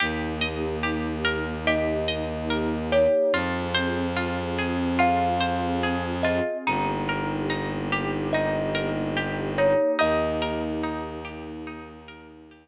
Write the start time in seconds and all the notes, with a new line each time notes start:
0.00 D#2 A#3 D#4 G4
0.41 D#5
0.83 G4
1.25 A#4
1.67 G4 D#5
2.08 D#5
2.50 A#4
2.92 G4 C#5
3.33 F2 C4 F4 G#4
3.74 C5
4.16 F4
4.59 G#4
4.99 F4 F5
5.40 C5
5.83 G#4
6.23 F4 D#5
6.66 G1 A#3 D#4 G4
7.09 A#4
7.50 D#4
7.92 G4
8.33 D#4 D#5
8.75 A#4
9.17 G4
9.58 D#4 C#5
9.99 D#2 A#3 D#4 G4 D#5
10.42 A#4
10.84 D#4
11.25 G4
11.67 D#4
12.08 A#4
12.51 G4